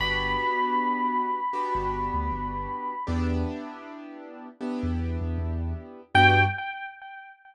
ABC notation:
X:1
M:4/4
L:1/16
Q:"Swing 16ths" 1/4=78
K:G
V:1 name="Electric Piano 1"
b16 | z16 | g4 z12 |]
V:2 name="Acoustic Grand Piano"
[B,DFG]8 [B,DFG]8 | [B,DEG]8 [B,DEG]8 | [B,DFG]4 z12 |]
V:3 name="Synth Bass 2" clef=bass
G,,,9 G,,,2 D,, G,,,4 | E,,9 E,,2 E,, E,,4 | G,,4 z12 |]